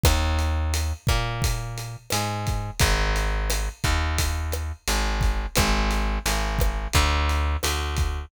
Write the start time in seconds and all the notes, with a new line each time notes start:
0.03 D#2, kick, cross-stick, closed hi-hat
0.39 closed hi-hat
0.74 closed hi-hat
1.07 A#2, kick, cross-stick, closed hi-hat
1.42 kick, closed hi-hat
1.78 closed hi-hat
2.10 G#2, cross-stick, closed hi-hat
2.47 kick, closed hi-hat
2.79 G#1, kick, closed hi-hat
3.16 closed hi-hat
3.50 cross-stick, closed hi-hat
3.84 D#2, kick, closed hi-hat
4.18 kick, closed hi-hat
4.52 cross-stick, closed hi-hat
4.87 G#1, closed hi-hat
5.21 kick, closed hi-hat
5.55 G#1, kick, cross-stick, closed hi-hat
5.91 closed hi-hat
6.26 G#1, closed hi-hat
6.59 kick, cross-stick, closed hi-hat
6.93 D2, kick, closed hi-hat
7.29 closed hi-hat
7.63 D2, cross-stick, closed hi-hat
7.97 kick, closed hi-hat